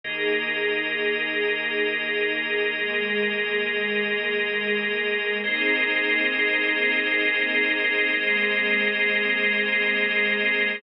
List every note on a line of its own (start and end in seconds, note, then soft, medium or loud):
0.04 5.01 D#2 loud
0.04 2.71 A#3 loud
0.04 2.71 D#4 medium
0.04 2.71 G#4 medium
0.04 5.38 G#4 medium
0.04 5.38 A#4 medium
0.04 5.38 D#5 medium
2.74 5.41 G#3 medium
2.74 5.41 A#3 medium
2.74 5.41 G#4 loud
5.43 10.39 G#1 loud
5.43 8.10 A#3 medium
5.43 8.10 C4 medium
5.43 8.10 D#4 medium
5.43 8.10 G#4 medium
5.43 10.78 G#4 medium
5.43 10.78 A#4 medium
5.43 10.78 C5 medium
5.43 10.78 D#5 medium
8.13 10.80 G#3 medium
8.13 10.80 A#3 medium
8.13 10.80 C4 medium
8.13 10.80 G#4 medium